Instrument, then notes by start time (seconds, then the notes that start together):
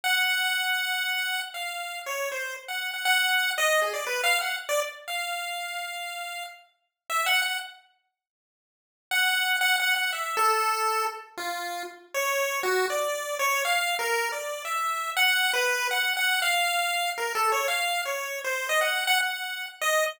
lead 1 (square)
0.04 F#5
1.54 F5
2.06 C#5
2.32 C5
2.68 F#5
2.94 F#5
3.05 F#5
3.58 D#5
3.82 G#4
3.93 D5
4.07 B4
4.24 F5
4.41 F#5
4.69 D5
5.08 F5
7.10 E5
7.26 F#5
7.42 F#5
9.11 F#5
9.61 F#5
9.80 F#5
9.96 F#5
10.13 E5
10.37 A4
11.37 F4
12.14 C#5
12.63 F#4
12.90 D5
13.39 C#5
13.65 F5
13.99 A#4
14.32 D5
14.65 E5
15.16 F#5
15.53 B4
15.91 F#5
16.17 F#5
16.42 F5
17.18 A#4
17.35 A4
17.52 C#5
17.68 F5
18.05 C#5
18.44 C5
18.69 D#5
18.81 F#5
19.07 F#5
19.21 F#5
19.81 D#5